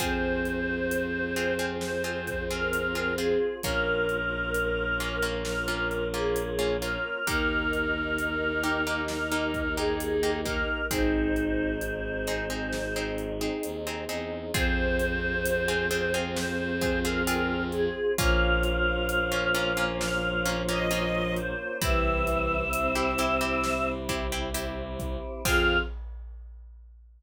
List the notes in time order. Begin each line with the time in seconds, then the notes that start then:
0.00 F2 C4 F4 G#4 C5, kick, closed hi-hat
0.45 closed hi-hat
0.91 closed hi-hat
1.36 C4 F4 G#4, closed hi-hat
1.59 C4 F4 G#4
1.81 C5, snare
2.04 C4 F4 G#4
2.27 kick, closed hi-hat
2.50 C4 F4 G#4 A#4
2.73 closed hi-hat
2.95 C4 F4 G#4
3.18 C4 F4 G#4, closed hi-hat
3.62 A#1 A#3 C#4 F4 A#4, kick, closed hi-hat
4.09 closed hi-hat
4.54 closed hi-hat
5.00 A#3 C#4 F4, closed hi-hat
5.22 A#3 C#4 F4
5.45 A#4, snare
5.68 A#3 C#4 F4
5.91 closed hi-hat
6.14 A#3 C#4 F4 G#4
6.36 closed hi-hat
6.59 A#3 C#4 F4
6.82 A#3 C#4 F4 A#4, closed hi-hat
7.26 D#2 A#3 D#4 G4 A#4, kick, closed hi-hat
7.73 closed hi-hat
8.19 closed hi-hat
8.63 A#3 D#4 G4, closed hi-hat
8.87 A#3 D#4 G4
9.08 A#4, snare
9.32 A#3 D#4 G4
9.54 kick, closed hi-hat
9.77 A#3 D#4 G4 G#4
10.00 closed hi-hat
10.23 A#3 D#4 G4
10.45 A#3 D#4 G4 A#4, kick, closed hi-hat
10.90 G#1 C4 D#4 G#4 C5, kick, closed hi-hat
11.36 closed hi-hat
11.81 closed hi-hat
12.27 C4 D#4 G#4, closed hi-hat
12.50 C4 D#4 G#4
12.73 snare
12.96 C4 D#4 G#4
13.18 closed hi-hat
13.41 C4 D#4 G#4
13.63 D#2, closed hi-hat
13.87 C4 D#4 G#4
14.09 E2 C4 D#4 G#4, closed hi-hat
14.54 F2 C4 F4 G#4 C5, kick, closed hi-hat
14.99 closed hi-hat
15.46 closed hi-hat
15.68 C4 F4 G#4
15.91 C4 F4 G#4, closed hi-hat
16.14 C4 F4 G#4
16.36 C5, snare
16.81 C4 F4 G#4, kick, closed hi-hat
17.04 C4 F4 G#4 A#4
17.27 C4 F4 G#4, closed hi-hat
17.72 G#4, closed hi-hat
18.18 A#1 F3 A#3 C#4 F4 F5, kick, closed hi-hat
18.63 closed hi-hat
19.09 closed hi-hat
19.32 A#3 C#4 F4
19.55 A#3 C#4 F4, closed hi-hat
19.77 A#3 C#4 F4
20.00 F5, snare
20.45 A#3 C#4 F4, closed hi-hat
20.69 A#3 C#4 F4 D#5
20.91 A#3 C#4 F4, closed hi-hat
21.37 C5, closed hi-hat
21.81 C2 E3 C4 E4 G4 E5, kick, closed hi-hat
22.27 closed hi-hat
22.73 C4, closed hi-hat
22.95 C4 E4 G4
23.18 C4 E4 G4, closed hi-hat
23.41 C4 E4 G4
23.64 snare
24.09 C4 E4 G4, kick, closed hi-hat
24.32 C4 E4 G4
24.54 C4 E4 G4, closed hi-hat
24.99 kick, closed hi-hat
25.45 F2 C4 F4 G#4 F5, kick, crash